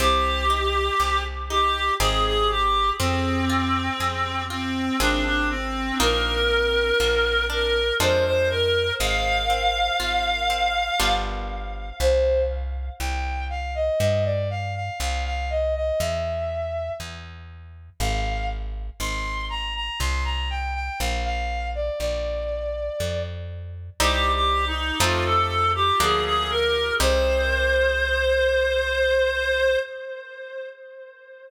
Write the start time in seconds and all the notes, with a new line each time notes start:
0.00 C2 C4 G4
0.50 D#4
1.00 C2 G4
1.50 D#4 G4
2.00 G#1 C4 D#4 G#4
2.25 G#4
2.50 G4
3.00 F2 C4
3.50 F4
4.00 F2 G#4
4.50 C4 F4
5.00 G#1 C4 D4 F4 G#4
5.25 D4
5.50 C4
6.00 A#1 A#3 D#4 F4 A#4
7.00 A#1 A#3
7.50 D4 A#4
8.00 F2 G#3 D4 F4 C5
8.25 C5
8.50 A#4
9.00 G#1 G#3 F5
9.50 C4
10.00 G#1 F4
10.50 C4
11.00 G1 G3 B3 D4 F4
12.00 C2 C5
13.00 C2 G5
13.50 F5
13.75 D#5
14.00 G2 D#5
14.25 D5
14.50 F5
14.75 F5
15.00 C2 F5
15.25 F5
15.50 D#5
15.75 D#5
16.00 E2 E5
17.00 E2
18.00 G#1 F5
19.00 G#1 C6
19.50 A#5
19.75 A#5
20.00 C2 C6
20.25 A#5
20.50 G5
20.75 G5
21.00 A#1 F5
21.25 F5
21.75 D5
22.00 A#1 D5
23.00 F2
24.00 C2 G3 C4 D#4 G4
24.34 G4
24.67 D#4
25.00 F2 F3 A3 C4 D#4 F4
25.25 A4
25.75 G4
26.00 D2 F3 A#3 D4 G#4
26.25 G#4
26.50 A#4
27.00 C2 C4 D#4 G4 C5